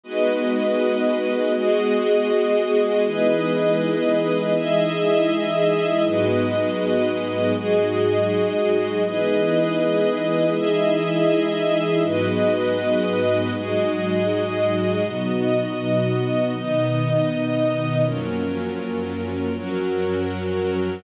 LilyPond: <<
  \new Staff \with { instrumentName = "Pad 2 (warm)" } { \time 4/4 \key gis \minor \tempo 4 = 80 <gis b dis' fis'>2 <gis b fis' gis'>2 | <e gis b dis'>2 <e gis dis' e'>2 | <gis, fis b dis'>2 <gis, fis gis dis'>2 | <e gis b dis'>2 <e gis dis' e'>2 |
<gis, fis b dis'>2 <gis, fis gis dis'>2 | <b, fis dis'>2 <b, dis dis'>2 | <fis, eis ais cis'>2 <fis, eis fis cis'>2 | }
  \new Staff \with { instrumentName = "String Ensemble 1" } { \time 4/4 \key gis \minor <gis fis' b' dis''>2 <gis fis' gis' dis''>2 | <e' gis' b' dis''>2 <e' gis' dis'' e''>2 | <gis fis' b' dis''>2 <gis fis' gis' dis''>2 | <e' gis' b' dis''>2 <e' gis' dis'' e''>2 |
<gis fis' b' dis''>2 <gis fis' gis' dis''>2 | <b fis' dis''>2 <b dis' dis''>2 | <fis cis' eis' ais'>2 <fis cis' fis' ais'>2 | }
>>